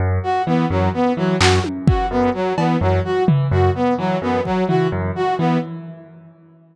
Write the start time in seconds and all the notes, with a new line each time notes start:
0.00 F#2
0.23 F#4
0.47 E3 B3
0.70 F#2 F#3
0.94 B3
1.17 E3 F#3
1.41 F#2 F#4, clap
1.64 high tom
1.87 E3 F#4, kick
2.11 F#2 B3
2.34 F#3
2.58 E3 B3, cowbell
2.81 F#2 F#3
3.05 F#4
3.28 E3, floor tom
3.51 F#2 F#4
3.75 B3
3.98 E3 F#3
4.22 F#2 B3
4.45 F#3, kick
4.69 E3 F#4, floor tom
4.92 F#2
5.16 F#4
5.39 E3 B3